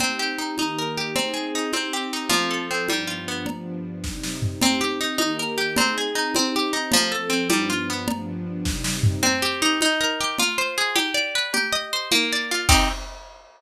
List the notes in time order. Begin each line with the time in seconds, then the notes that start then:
0.00 C4 D#4 G4, cowbell, low conga
0.19 G4
0.38 D#4
0.57 D#3 A#3 D#4 G4, cowbell, high conga
0.78 A#4
0.97 G4
1.15 C4 D#4 G#4, cowbell, low conga
1.33 G#4
1.55 D#4
1.73 C4 D#4 G4, cowbell, high conga
1.93 G4
2.13 D#4
2.29 F3 C4 A4, cowbell, low conga
2.50 A4
2.70 C4
2.88 G2 F3 G3 B3 D4, cowbell, high conga
3.07 F4
3.27 B3
3.46 G2 F3 B3 D4, cowbell, low conga
4.03 C3 G3 D#4, kick, snare
4.23 snare
4.42 floor tom
4.61 C4 D#4 G4, cowbell, low conga
4.81 G4
5.01 D#4
5.18 D#3 A#3 D#4 G4, cowbell, high conga
5.39 A#4
5.57 G4
5.76 C4 D#4 G#4, cowbell, low conga
5.97 G#4
6.15 D#4
6.35 C4 D#4 G4, cowbell, high conga
6.55 G4
6.72 D#4
6.92 F3 C4 A4, cowbell, low conga
7.11 A4
7.29 C4
7.49 G2 F3 G3 B3 D4, cowbell, high conga
7.70 F4
7.90 B3
8.08 G2 F3 B3 D4, cowbell, low conga
8.65 C3 G3 D#4, kick, snare
8.84 snare
9.03 floor tom
9.22 C4, cowbell, low conga
9.42 G4
9.61 D#4
9.81 D#4, cowbell, high conga
10.00 A#4
10.20 G4
10.38 F4, cowbell, low conga
10.58 C5
10.78 G#4
10.95 G4, cowbell, high conga
11.14 D5
11.35 B4
11.53 G4, cowbell, low conga
11.72 D#5
11.92 C5
12.11 A#3, cowbell, high conga
12.32 D5
12.51 F4
12.68 C4 D#4 G4, kick, crash